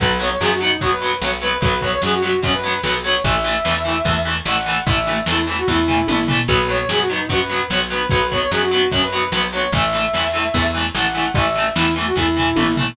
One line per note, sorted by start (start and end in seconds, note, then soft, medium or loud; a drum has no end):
0.00 0.36 B1 loud
0.00 0.08 F#3 loud
0.00 0.08 B3 loud
0.00 0.18 B4 medium
0.00 kick loud
0.00 closed hi-hat medium
0.20 0.28 F#3 medium
0.20 0.28 B3 medium
0.20 0.30 C#5 medium
0.20 closed hi-hat medium
0.30 0.40 C#5 medium
0.40 0.77 F#2 medium
0.40 0.49 F#3 medium
0.40 0.49 B3 medium
0.40 0.50 G#4 medium
0.40 snare loud
0.51 0.60 F#4 medium
0.60 0.69 F#3 medium
0.60 0.69 B3 medium
0.60 0.78 D#4 medium
0.60 closed hi-hat medium
0.81 1.18 F#2 medium
0.81 0.89 F#3 medium
0.81 0.89 B3 medium
0.81 0.91 F#4 medium
0.81 kick medium
0.81 closed hi-hat medium
0.91 1.17 B4 medium
1.01 1.10 F#3 medium
1.01 1.10 B3 medium
1.01 closed hi-hat medium
1.21 1.58 B1 medium
1.21 1.30 F#3 medium
1.21 1.30 B3 medium
1.21 1.31 C#5 medium
1.21 snare loud
1.41 1.50 F#3 medium
1.41 1.50 B3 loud
1.41 1.58 B4 medium
1.41 closed hi-hat medium
1.61 1.99 B1 medium
1.61 1.70 F#3 medium
1.61 1.70 B3 medium
1.61 1.78 B4 loud
1.61 kick loud
1.61 closed hi-hat medium
1.81 1.90 F#3 medium
1.81 1.90 B3 medium
1.81 1.92 C#5 medium
1.81 kick medium
1.81 closed hi-hat medium
1.93 2.02 C#5 loud
2.02 2.39 F#2 medium
2.02 2.11 F#3 medium
2.02 2.11 B3 medium
2.02 2.12 G#4 medium
2.02 snare loud
2.13 2.22 F#4 medium
2.22 2.31 F#3 medium
2.22 2.31 B3 medium
2.22 2.40 F#4 medium
2.22 closed hi-hat medium
2.43 2.80 F#2 medium
2.43 2.51 F#3 medium
2.43 2.51 B3 medium
2.43 2.53 C#4 medium
2.43 kick medium
2.43 closed hi-hat loud
2.54 2.81 B4 medium
2.63 2.72 F#3 medium
2.63 2.72 B3 medium
2.63 closed hi-hat medium
2.83 3.20 B1 medium
2.83 2.93 F#3 loud
2.83 2.93 B3 loud
2.83 2.93 B4 medium
2.83 snare loud
3.04 3.12 F#3 medium
3.04 3.12 B3 medium
3.04 3.23 C#5 medium
3.04 closed hi-hat medium
3.24 3.61 A1 medium
3.24 3.33 E3 loud
3.24 3.33 A3 medium
3.24 4.22 E5 medium
3.24 kick loud
3.24 closed hi-hat medium
3.44 3.52 E3 medium
3.44 3.52 A3 medium
3.44 closed hi-hat medium
3.65 4.02 E2 medium
3.65 3.73 E3 medium
3.65 3.73 A3 medium
3.65 snare loud
3.85 3.93 E3 medium
3.85 3.93 A3 medium
3.85 closed hi-hat medium
4.05 4.42 E2 medium
4.05 4.13 E3 medium
4.05 4.13 A3 medium
4.05 kick medium
4.05 closed hi-hat medium
4.25 4.33 E3 medium
4.25 4.33 A3 medium
4.25 closed hi-hat medium
4.45 4.82 A1 medium
4.45 4.53 E3 medium
4.45 4.53 A3 medium
4.45 4.84 F#5 medium
4.45 snare loud
4.66 4.74 E3 medium
4.66 4.74 A3 medium
4.66 closed hi-hat medium
4.87 5.23 A1 medium
4.87 4.95 E3 medium
4.87 4.95 A3 medium
4.87 5.21 E5 medium
4.87 kick loud
4.87 closed hi-hat loud
5.06 5.15 E3 medium
5.06 5.15 A3 medium
5.06 closed hi-hat medium
5.26 5.64 E2 medium
5.26 5.35 E3 loud
5.26 5.35 A3 medium
5.26 5.46 E4 medium
5.26 snare loud
5.47 5.56 E3 medium
5.47 5.56 A3 medium
5.47 closed hi-hat medium
5.58 5.67 F#4 medium
5.67 6.05 E2 medium
5.67 5.76 E3 medium
5.67 5.76 A3 medium
5.67 6.24 E4 medium
5.67 kick medium
5.88 5.96 E3 medium
5.88 5.96 A3 medium
5.88 floor tom medium
6.08 6.45 A1 medium
6.08 6.16 E3 medium
6.08 6.16 A3 medium
6.08 high tom medium
6.28 6.36 E3 loud
6.28 6.36 A3 medium
6.28 floor tom loud
6.48 6.85 B1 loud
6.48 6.56 F#3 loud
6.48 6.56 B3 loud
6.48 6.66 B4 medium
6.48 kick loud
6.48 closed hi-hat medium
6.68 6.77 F#3 medium
6.68 6.77 B3 medium
6.68 6.79 C#5 medium
6.68 closed hi-hat medium
6.79 6.89 C#5 medium
6.89 7.26 F#2 medium
6.89 6.98 F#3 medium
6.89 6.98 B3 medium
6.89 6.99 G#4 medium
6.89 snare loud
6.99 7.09 F#4 medium
7.10 7.18 F#3 medium
7.10 7.18 B3 medium
7.10 7.26 D#4 medium
7.10 closed hi-hat medium
7.29 7.66 F#2 medium
7.29 7.38 F#3 medium
7.29 7.38 B3 medium
7.29 7.39 F#4 medium
7.29 kick medium
7.29 closed hi-hat medium
7.40 7.66 B4 medium
7.49 7.58 F#3 medium
7.49 7.58 B3 medium
7.49 closed hi-hat medium
7.70 8.07 B1 medium
7.70 7.79 F#3 medium
7.70 7.79 B3 medium
7.70 7.80 C#5 medium
7.70 snare loud
7.90 7.98 F#3 medium
7.90 7.98 B3 loud
7.90 8.07 B4 medium
7.90 closed hi-hat medium
8.10 8.48 B1 medium
8.10 8.18 F#3 medium
8.10 8.18 B3 medium
8.10 8.27 B4 loud
8.10 kick loud
8.10 closed hi-hat medium
8.31 8.40 F#3 medium
8.31 8.40 B3 medium
8.31 8.41 C#5 medium
8.31 kick medium
8.31 closed hi-hat medium
8.41 8.51 C#5 loud
8.51 8.88 F#2 medium
8.51 8.60 F#3 medium
8.51 8.60 B3 medium
8.51 8.61 G#4 medium
8.51 snare loud
8.62 8.71 F#4 medium
8.71 8.80 F#3 medium
8.71 8.80 B3 medium
8.71 8.88 F#4 medium
8.71 closed hi-hat medium
8.92 9.29 F#2 medium
8.92 9.00 F#3 medium
8.92 9.00 B3 medium
8.92 9.01 C#4 medium
8.92 kick medium
8.92 closed hi-hat loud
9.02 9.30 B4 medium
9.12 9.21 F#3 medium
9.12 9.21 B3 medium
9.12 closed hi-hat medium
9.32 9.69 B1 medium
9.32 9.41 F#3 loud
9.32 9.41 B3 loud
9.32 9.42 B4 medium
9.32 snare loud
9.53 9.61 F#3 medium
9.53 9.61 B3 medium
9.53 9.71 C#5 medium
9.53 closed hi-hat medium
9.72 10.09 A1 medium
9.72 9.81 E3 loud
9.72 9.81 A3 medium
9.72 10.71 E5 medium
9.72 kick loud
9.72 closed hi-hat medium
9.93 10.01 E3 medium
9.93 10.01 A3 medium
9.93 closed hi-hat medium
10.14 10.50 E2 medium
10.14 10.22 E3 medium
10.14 10.22 A3 medium
10.14 snare loud
10.33 10.42 E3 medium
10.33 10.42 A3 medium
10.33 closed hi-hat medium
10.54 10.91 E2 medium
10.54 10.62 E3 medium
10.54 10.62 A3 medium
10.54 kick medium
10.54 closed hi-hat medium
10.73 10.83 E3 medium
10.73 10.83 A3 medium
10.73 closed hi-hat medium
10.94 11.31 A1 medium
10.94 11.03 E3 medium
10.94 11.03 A3 medium
10.94 11.32 F#5 medium
10.94 snare loud
11.14 11.23 E3 medium
11.14 11.23 A3 medium
11.14 closed hi-hat medium
11.34 11.72 A1 medium
11.34 11.43 E3 medium
11.34 11.43 A3 medium
11.34 11.69 E5 medium
11.34 kick loud
11.34 closed hi-hat loud
11.55 11.64 E3 medium
11.55 11.64 A3 medium
11.55 closed hi-hat medium
11.76 12.12 E2 medium
11.76 11.84 E3 loud
11.76 11.84 A3 medium
11.76 11.94 E4 medium
11.76 snare loud
11.96 12.04 E3 medium
11.96 12.04 A3 medium
11.96 closed hi-hat medium
12.06 12.15 F#4 medium
12.16 12.53 E2 medium
12.16 12.24 E3 medium
12.16 12.24 A3 medium
12.16 12.73 E4 medium
12.16 kick medium
12.37 12.45 E3 medium
12.37 12.45 A3 medium
12.37 floor tom medium
12.56 12.93 A1 medium
12.56 12.64 E3 medium
12.56 12.64 A3 medium
12.56 high tom medium
12.77 12.85 E3 loud
12.77 12.85 A3 medium
12.77 floor tom loud